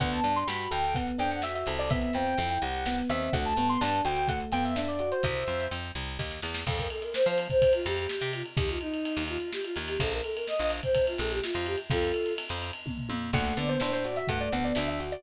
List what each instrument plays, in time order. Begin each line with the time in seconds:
0.00 electric bass (finger) D2, electric piano 1 B3, ocarina F#5, kick, closed hi-hat
0.12 ocarina A5, closed hi-hat
0.23 electric bass (finger) G2, electric piano 1 D4, closed hi-hat
0.36 ocarina C6, closed hi-hat
0.47 electric bass (finger) G2, electric piano 1 F#4, ocarina B5, snare
0.60 closed hi-hat
0.71 electric bass (finger) D2, electric piano 1 A4, ocarina G5, closed hi-hat
0.83 closed hi-hat
0.95 electric piano 1 B3, ocarina F#5, kick, closed hi-hat
1.07 closed hi-hat
1.18 electric bass (finger) F2, electric piano 1 D4, ocarina G5, closed hi-hat
1.31 ocarina F#5, closed hi-hat
1.42 electric piano 1 F#4, ocarina E5, snare
1.54 ocarina E5, closed hi-hat
1.66 electric bass (finger) C2, electric piano 1 A4, closed hi-hat
1.79 ocarina D5, open hi-hat
1.90 electric piano 1 B3, ocarina E5, kick, closed hi-hat
2.01 closed hi-hat
2.13 electric bass (finger) F2, electric piano 1 C4, ocarina G5, closed hi-hat
2.27 closed hi-hat
2.38 electric bass (finger) F2, electric piano 1 E4, closed hi-hat
2.49 ocarina G5, closed hi-hat
2.62 electric bass (finger) C2, electric piano 1 G4, ocarina F#5, closed hi-hat
2.74 closed hi-hat
2.86 electric piano 1 B3, ocarina F#5, snare
2.98 closed hi-hat
3.09 electric bass (finger) D#2, electric piano 1 C4, ocarina E5, closed hi-hat
3.22 closed hi-hat
3.33 electric bass (finger) D2, electric piano 1 A3, ocarina F#5, kick, closed hi-hat
3.45 ocarina A5, closed hi-hat
3.56 electric bass (finger) G2, electric piano 1 B3, closed hi-hat
3.69 ocarina C6, closed hi-hat
3.81 electric bass (finger) G2, electric piano 1 D4, ocarina A5, snare
3.94 closed hi-hat
4.05 electric bass (finger) D2, electric piano 1 F#4, ocarina G5, closed hi-hat
4.16 closed hi-hat
4.28 electric piano 1 A3, ocarina F#5, kick, closed hi-hat
4.40 closed hi-hat
4.52 electric bass (finger) F2, electric piano 1 B3, ocarina G5, closed hi-hat
4.64 ocarina E5, closed hi-hat
4.76 electric piano 1 D4, ocarina E5, snare
4.88 ocarina D5, closed hi-hat
4.99 electric piano 1 F#4, closed hi-hat
5.11 ocarina C5, closed hi-hat
5.23 electric bass (finger) C2, ocarina C5 E5, kick, closed hi-hat
5.37 closed hi-hat
5.47 electric bass (finger) F2, closed hi-hat
5.60 closed hi-hat
5.71 electric bass (finger) F2, closed hi-hat
5.84 closed hi-hat
5.95 electric bass (finger) C2, closed hi-hat
6.07 closed hi-hat
6.19 electric bass (finger) D#2, kick, snare
6.31 snare
6.42 electric bass (finger) E2, snare
6.54 snare
6.67 electric bass (finger) F2, choir aahs A4, kick, crash
6.78 choir aahs A#4, kick, ride
6.90 choir aahs A4, ride
7.02 choir aahs A#4, ride
7.14 choir aahs C5, snare
7.26 electric bass (finger) F3, choir aahs C5, ride
7.38 ride
7.50 choir aahs C5, kick, ride
7.62 kick, ride
7.73 choir aahs F4, ride
7.86 electric bass (finger) F2, choir aahs G4, ride
7.97 choir aahs G4, ride
8.09 choir aahs G4, snare
8.21 electric bass (finger) C3, ride
8.33 choir aahs F4, ride
8.46 ride
8.57 electric bass (finger) D#2, choir aahs G4, kick, ride
8.69 choir aahs F4, ride
8.81 choir aahs D#4, ride
8.94 ride
9.05 ride
9.17 electric bass (finger) D#2, ride
9.28 choir aahs F4, ride
9.40 ride
9.53 choir aahs G4, snare
9.64 choir aahs F4, ride
9.76 electric bass (finger) D#2, ride
9.88 choir aahs G4, ride
10.00 electric bass (finger) A#1, choir aahs A4, kick, ride
10.12 choir aahs A#4, ride
10.24 choir aahs A4, ride
10.36 choir aahs A#4, ride
10.47 choir aahs D#5, snare
10.59 electric bass (finger) A#1, choir aahs D#5, ride
10.70 ride
10.83 choir aahs C5, kick, ride
10.95 kick, ride
11.07 choir aahs F4, ride
11.18 electric bass (finger) A#1, choir aahs A4, ride
11.31 choir aahs G4, ride
11.43 choir aahs F4, snare
11.54 electric bass (finger) F2, ride
11.66 choir aahs G4, ride
11.78 ride
11.90 electric bass (finger) F2, choir aahs F4 A4, kick, ride
12.02 ride
12.14 ride
12.26 ride
12.38 ride
12.49 electric bass (finger) F2, ride
12.62 ride
12.73 ride
12.86 kick, high tom
12.98 floor tom
13.09 electric bass (finger) F2, high tom
13.33 electric bass (finger) D2, electric piano 1 A3, ocarina F#5, kick, crash
13.45 closed hi-hat
13.57 electric bass (finger) D3, electric piano 1 B3, ocarina D5, closed hi-hat
13.69 ocarina C5, closed hi-hat
13.80 electric bass (finger) A2, electric piano 1 D4, ocarina C5, snare
13.93 ocarina C5, closed hi-hat
14.04 electric piano 1 F#4, ocarina D5, closed hi-hat
14.16 ocarina E5, closed hi-hat
14.28 electric bass (finger) G2, electric piano 1 A3, ocarina F#5, kick, closed hi-hat
14.40 ocarina D5, closed hi-hat
14.52 electric bass (finger) D2, electric piano 1 B3, ocarina F#5, closed hi-hat
14.64 ocarina D5, closed hi-hat
14.75 electric bass (finger) D2, electric piano 1 D4, ocarina E5, snare
14.88 ocarina E5, closed hi-hat
15.00 electric piano 1 F#4, closed hi-hat
15.12 ocarina D5, closed hi-hat